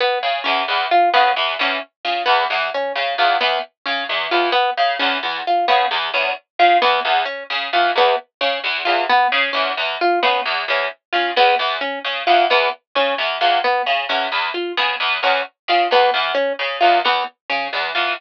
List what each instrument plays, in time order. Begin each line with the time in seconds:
0.00 orchestral harp B3
0.23 pizzicato strings C#3
0.44 pizzicato strings E2, orchestral harp C#4
0.68 pizzicato strings E2
0.91 orchestral harp F4
1.14 pizzicato strings C#3, orchestral harp B3
1.36 pizzicato strings E2
1.59 pizzicato strings E2, orchestral harp C#4
2.05 pizzicato strings C#3, orchestral harp F4
2.26 pizzicato strings E2, orchestral harp B3
2.50 pizzicato strings E2
2.74 orchestral harp C#4
2.95 pizzicato strings C#3
3.18 pizzicato strings E2, orchestral harp F4
3.41 pizzicato strings E2, orchestral harp B3
3.86 pizzicato strings C#3, orchestral harp C#4
4.09 pizzicato strings E2
4.31 pizzicato strings E2, orchestral harp F4
4.52 orchestral harp B3
4.77 pizzicato strings C#3
4.99 pizzicato strings E2, orchestral harp C#4
5.23 pizzicato strings E2
5.47 orchestral harp F4
5.68 pizzicato strings C#3, orchestral harp B3
5.91 pizzicato strings E2
6.14 pizzicato strings E2, orchestral harp C#4
6.59 pizzicato strings C#3, orchestral harp F4
6.82 pizzicato strings E2, orchestral harp B3
7.05 pizzicato strings E2
7.25 orchestral harp C#4
7.50 pizzicato strings C#3
7.73 pizzicato strings E2, orchestral harp F4
7.96 pizzicato strings E2, orchestral harp B3
8.41 pizzicato strings C#3, orchestral harp C#4
8.64 pizzicato strings E2
8.85 pizzicato strings E2, orchestral harp F4
9.09 orchestral harp B3
9.32 pizzicato strings C#3
9.53 pizzicato strings E2, orchestral harp C#4
9.77 pizzicato strings E2
10.01 orchestral harp F4
10.23 pizzicato strings C#3, orchestral harp B3
10.45 pizzicato strings E2
10.68 pizzicato strings E2, orchestral harp C#4
11.13 pizzicato strings C#3, orchestral harp F4
11.36 pizzicato strings E2, orchestral harp B3
11.59 pizzicato strings E2
11.81 orchestral harp C#4
12.05 pizzicato strings C#3
12.27 pizzicato strings E2, orchestral harp F4
12.50 pizzicato strings E2, orchestral harp B3
12.95 pizzicato strings C#3, orchestral harp C#4
13.18 pizzicato strings E2
13.41 pizzicato strings E2, orchestral harp F4
13.64 orchestral harp B3
13.86 pizzicato strings C#3
14.09 pizzicato strings E2, orchestral harp C#4
14.32 pizzicato strings E2
14.54 orchestral harp F4
14.77 pizzicato strings C#3, orchestral harp B3
15.00 pizzicato strings E2
15.23 pizzicato strings E2, orchestral harp C#4
15.68 pizzicato strings C#3, orchestral harp F4
15.91 pizzicato strings E2, orchestral harp B3
16.14 pizzicato strings E2
16.35 orchestral harp C#4
16.59 pizzicato strings C#3
16.81 pizzicato strings E2, orchestral harp F4
17.05 pizzicato strings E2, orchestral harp B3
17.50 pizzicato strings C#3, orchestral harp C#4
17.73 pizzicato strings E2
17.95 pizzicato strings E2, orchestral harp F4